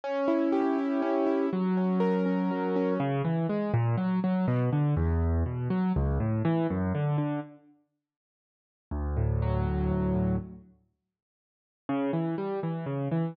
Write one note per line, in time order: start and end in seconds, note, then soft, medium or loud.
0.04 1.02 C#4 medium
0.28 0.78 E4 medium
0.52 1.46 G4 medium
0.78 1.26 E4 medium
1.02 1.49 C#4 medium
1.26 1.50 E4 medium
1.53 2.50 F#3 medium
1.77 2.25 C#4 soft
2.00 2.94 A#4 medium
2.26 2.75 C#4 soft
2.51 2.98 F#3 medium
2.76 2.99 C#4 medium
3.00 3.22 C#3 loud
3.24 3.47 E3 medium
3.49 3.72 G#3 medium
3.74 3.96 A#2 medium
3.97 4.20 F#3 medium
4.24 4.46 F#3 medium
4.48 4.70 B2 medium
4.73 4.95 D3 medium
4.97 5.44 E2 loud
5.46 5.68 B2 medium
5.70 5.92 F#3 medium
5.96 6.18 C#2 loud
6.20 6.42 A2 medium
6.45 6.67 E3 medium
6.70 6.93 F#2 medium
6.95 7.17 D3 medium
7.18 7.40 D3 medium
8.91 9.91 D2 medium
9.17 9.66 A2 medium
9.42 10.36 F#3 medium
9.66 10.14 A2 medium
9.91 10.38 D2 medium
10.14 10.38 A2 medium
11.89 12.11 C#3 medium
12.13 12.35 E3 medium
12.38 12.60 G3 medium
12.63 12.85 E3 medium
12.86 13.08 C#3 medium
13.11 13.34 E3 medium